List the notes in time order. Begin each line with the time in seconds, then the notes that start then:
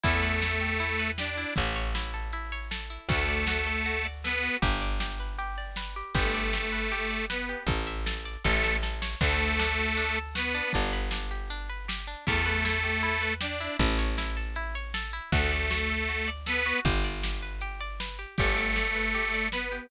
0.04 E2 A3 E4 A4, kick, closed hi-hat
0.23 B4
0.42 E4, snare
0.61 G4
0.80 E4, closed hi-hat
0.99 B4
1.18 D4 G4 D5, snare
1.37 E4
1.56 A1 E4, kick, closed hi-hat
1.76 C#5
1.95 E4, snare
2.14 A4
2.33 E4, closed hi-hat
2.52 C#5
2.71 A4, snare
2.90 E4
3.09 D2 A3 F#4 A4, kick, closed hi-hat
3.29 D5
3.47 F#4, snare
3.67 A4
3.86 F#4, closed hi-hat
4.05 D5
4.24 B3 A4 B4, snare
4.43 F#4
4.62 G1 G4, kick, closed hi-hat
4.81 D5
5.00 G4, snare
5.20 B4
5.39 G4, closed hi-hat
5.58 D5
5.76 B4, snare
5.96 G4
6.14 G1 A3 G4 A4, kick, closed hi-hat
6.34 D5
6.53 G4, snare
6.72 B4
6.92 G4, closed hi-hat
7.11 D5
7.30 B3 B4, snare
7.49 G4
7.67 A1 A4, kick, closed hi-hat
7.87 E5
8.06 A4, snare
8.25 D5
8.44 A1 A3 A4, kick, snare
8.63 E5, snare
8.83 A4, snare
9.02 C#5, snare
9.21 D2 A3 D4 A4, kick, closed hi-hat
9.40 A4
9.59 D4, snare
9.78 F#4
9.97 D4, closed hi-hat
10.16 A4
10.35 B3 F#4 B4, snare
10.55 D4
10.73 G1 D4, kick, closed hi-hat
10.93 B4
11.11 D4, snare
11.31 G4
11.50 D4, closed hi-hat
11.70 B4
11.88 G4, snare
12.07 D4
12.27 E2 A3 E4 A4, kick, closed hi-hat
12.46 B4
12.65 E4, snare
12.84 G4
13.02 E4, closed hi-hat
13.22 B4
13.41 D4 G4 D5, snare
13.60 E4
13.79 A1 E4, kick, closed hi-hat
13.99 C#5
14.18 E4, snare
14.37 A4
14.56 E4, closed hi-hat
14.75 C#5
14.94 A4, snare
15.13 E4
15.32 D2 A3 F#4 A4, kick, closed hi-hat
15.52 D5
15.70 F#4, snare
15.90 A4
16.09 F#4, closed hi-hat
16.28 D5
16.46 B3 A4 B4, snare
16.66 F#4
16.85 G1 G4, kick, closed hi-hat
17.05 D5
17.23 G4, snare
17.42 B4
17.61 G4, closed hi-hat
17.80 D5
18.00 B4, snare
18.19 G4
18.38 G1 A3 G4 A4, kick, closed hi-hat
18.57 D5
18.76 G4, snare
18.95 B4
19.15 G4, closed hi-hat
19.34 D5
19.52 B3 B4, snare
19.72 G4